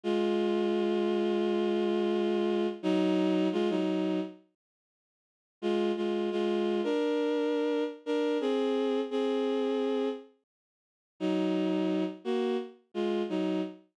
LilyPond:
\new Staff { \time 4/4 \key ees \dorian \tempo 4 = 86 <aes f'>1 | <ges ees'>4 <aes f'>16 <ges ees'>8. r2 | <aes f'>8 <aes f'>8 <aes f'>8. <d' bes'>4.~ <d' bes'>16 <d' bes'>8 | <c' aes'>4 <c' aes'>4. r4. |
<ges ees'>4. <bes ges'>8 r8 <aes f'>8 <ges ees'>8 r8 | }